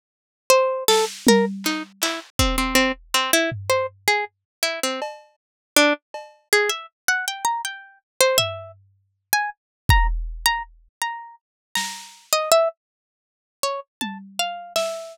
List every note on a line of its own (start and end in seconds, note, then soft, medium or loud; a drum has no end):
0.50 0.84 C5 medium
0.88 1.05 A4 loud
0.88 snare loud
1.27 1.45 A#4 medium
1.27 high tom loud
1.64 1.83 D#4 medium
1.64 clap medium
2.02 2.20 E4 medium
2.02 clap medium
2.39 2.56 C4 medium
2.39 kick medium
2.58 2.75 C4 medium
2.75 2.92 C4 medium
3.14 3.31 C4 medium
3.33 3.50 E4 loud
3.52 floor tom medium
3.70 3.87 C5 medium
4.08 4.25 G#4 medium
4.63 4.80 E4 medium
4.83 5.00 C4 medium
5.02 cowbell loud
5.76 5.93 D4 loud
6.14 cowbell medium
6.53 6.70 G#4 medium
6.70 6.86 E5 medium
7.08 7.25 F#5 medium
7.28 7.45 G5 medium
7.45 7.62 A#5 medium
7.65 7.99 G5 medium
8.21 8.38 C5 medium
8.38 8.72 E5 loud
8.38 floor tom medium
9.33 9.50 G#5 loud
9.89 10.07 A#5 loud
9.89 kick loud
10.46 10.63 A#5 loud
11.02 11.35 A#5 medium
11.75 12.26 A#5 medium
11.75 snare medium
12.33 12.50 D#5 medium
12.52 12.68 E5 medium
13.63 13.80 C#5 medium
14.01 14.18 A5 medium
14.01 high tom medium
14.39 14.73 F5 medium
14.76 15.17 E5 medium
14.76 snare medium